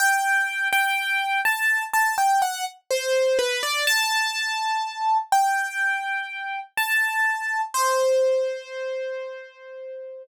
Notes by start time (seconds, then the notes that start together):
0.00 G5
0.73 G5
1.45 A5
1.94 A5
2.18 G5
2.42 F#5
2.91 C5
3.39 B4
3.63 D5
3.87 A5
5.32 G5
6.77 A5
7.74 C5